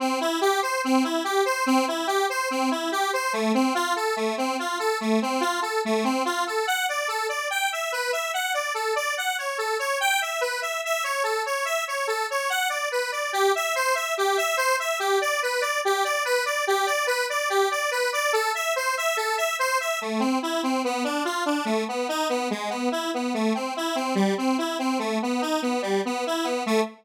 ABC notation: X:1
M:4/4
L:1/8
Q:1/4=144
K:C
V:1 name="Lead 1 (square)"
C E G c C E G c | C E G c C E G c | A, C F A A, C F A | A, C F A A, C F A |
[K:D] f d A d g e B e | f d A d f c A c | g e B e e c A c | e c A c f d B d |
[K:C] G e c e G e c e | G d B d G d B d | G d B d G d B d | A e c e A e c e |
[K:Am] A, C E C B, D F D | A, B, ^D B, ^G, B, E B, | A, C E C G, C E C | A, B, ^D B, G, B, E B, |
A,2 z6 |]